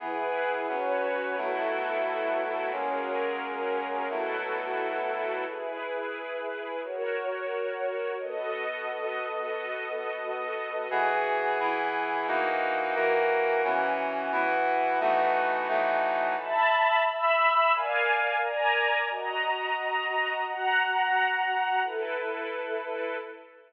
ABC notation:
X:1
M:6/8
L:1/8
Q:3/8=88
K:Elyd
V:1 name="Brass Section"
[E,B,G]3 [F,B,C]3 | [B,,F,=A,E]6 | [F,G,A,C]6 | [B,,F,=A,E]6 |
z6 | z6 | z6 | z6 |
[E,B,FG]3 [E,B,EG]3 | [E,A,DF]3 [E,A,FA]3 | [E,B,CF]3 [E,B,EF]3 | [E,=A,B,DF]3 [E,F,A,DF]3 |
z6 | z6 | z6 | z6 |
z6 |]
V:2 name="String Ensemble 1"
[EGB]3 [FBc]3 | [B,EF=A]6 | [F,CGA]6 | [B,EF=A]6 |
[EGB]6 | [FAc]6 | [B,F=Ad]6- | [B,F=Ad]6 |
z6 | z6 | z6 | z6 |
[e=ab]3 [ebe']3 | [A=d^eg]3 [Adga]3 | [Fda]6 | [Ffa]6 |
[E=AB]6 |]